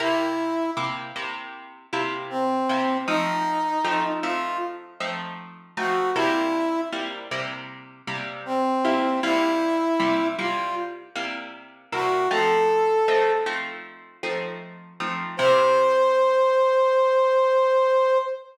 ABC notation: X:1
M:4/4
L:1/8
Q:1/4=78
K:C
V:1 name="Brass Section"
E2 z4 C2 | _E3 F z3 ^F | E2 z4 C2 | E3 F z3 ^F |
A3 z5 | c8 |]
V:2 name="Acoustic Guitar (steel)"
[C,_B,EG]2 [C,B,EG] [C,B,EG]2 [C,B,EG]2 [C,B,EG] | [F,A,C_E]2 [F,A,CE] [F,A,CE]2 [F,A,CE]2 [F,A,CE] | [C,G,_B,E]2 [C,G,B,E] [C,G,B,E]2 [C,G,B,E]2 [C,G,B,E] | [C,G,_B,E]2 [C,G,B,E] [C,G,B,E]2 [C,G,B,E]2 [C,G,B,E] |
[F,A,C_E]2 [F,A,CE] [F,A,CE]2 [F,A,CE]2 [F,A,CE] | [C,_B,EG]8 |]